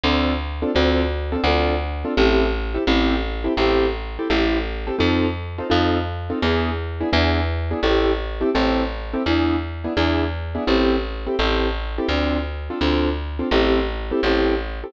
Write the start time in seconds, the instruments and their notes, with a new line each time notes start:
0.03 electric bass (finger) D2, acoustic grand piano C4 D4 F4 A4
0.62 acoustic grand piano C4 D4 F4 A4
0.75 electric bass (finger) D2, acoustic grand piano C4 D4 F4 A4
1.32 acoustic grand piano C4 D4 F4 A4
1.44 electric bass (finger) D2, acoustic grand piano C4 D4 F4 A4
2.05 acoustic grand piano C4 D4 F4 A4
2.17 electric bass (finger) A1, acoustic grand piano C4 E4 G4 A4
2.74 acoustic grand piano C4 E4 G4 A4
2.87 electric bass (finger) A1, acoustic grand piano C4 E4 G4 A4
3.44 acoustic grand piano C4 E4 G4 A4
3.57 electric bass (finger) A1, acoustic grand piano C4 E4 G4 A4
4.19 acoustic grand piano C4 E4 G4 A4
4.30 electric bass (finger) A1, acoustic grand piano C4 E4 G4 A4
4.87 acoustic grand piano C4 E4 G4 A4
4.99 electric bass (finger) F2, acoustic grand piano C4 D#4 F4 A4
5.58 acoustic grand piano C4 D#4 F4 A4
5.70 electric bass (finger) F2, acoustic grand piano C4 D#4 F4 A4
6.30 acoustic grand piano C4 D#4 F4 A4
6.42 electric bass (finger) E2, acoustic grand piano B3 D4 E4 G#4
7.00 acoustic grand piano B3 D4 E4 G#4
7.13 electric bass (finger) E2, acoustic grand piano B3 D4 E4 G#4
7.71 acoustic grand piano B3 D4 E4 G#4
7.83 electric bass (finger) A1, acoustic grand piano C4 E4 G4 A4
8.41 acoustic grand piano C4 E4 G4 A4
8.55 electric bass (finger) A1, acoustic grand piano C4 E4 G4 A4
9.13 acoustic grand piano C4 E4 G4 A4
9.26 electric bass (finger) E2, acoustic grand piano B3 D4 E4 G#4
9.84 acoustic grand piano B3 D4 E4 G#4
9.97 electric bass (finger) E2, acoustic grand piano B3 D4 E4 G#4
10.55 acoustic grand piano B3 D4 E4 G#4
10.67 electric bass (finger) A1, acoustic grand piano C4 E4 G4 A4
11.27 acoustic grand piano C4 E4 G4 A4
11.39 electric bass (finger) A1, acoustic grand piano C4 E4 G4 A4
11.98 acoustic grand piano C4 E4 G4 A4
12.09 electric bass (finger) D2, acoustic grand piano C4 D4 F4 A4
12.70 acoustic grand piano C4 D4 F4 A4
12.81 electric bass (finger) D2, acoustic grand piano C4 D4 F4 A4
13.39 acoustic grand piano C4 D4 F4 A4
13.51 electric bass (finger) A1, acoustic grand piano C4 E4 G4 A4
14.11 acoustic grand piano C4 E4 G4 A4
14.23 electric bass (finger) A1, acoustic grand piano C4 E4 G4 A4
14.84 acoustic grand piano C4 E4 G4 A4